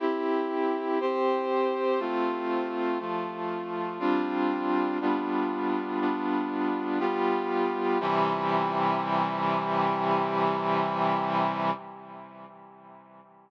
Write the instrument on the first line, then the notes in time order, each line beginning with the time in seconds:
brass section
0.00 C4 E4 G4
1.01 C4 G4 C5
2.00 A3 C4 F4
2.99 F3 A3 F4
3.99 G3 C4 D4 F4
5.01 G3 B3 D4 F4
6.00 G3 B3 D4 F4
6.99 G3 B3 F4 G4
8.00 C3 E3 G3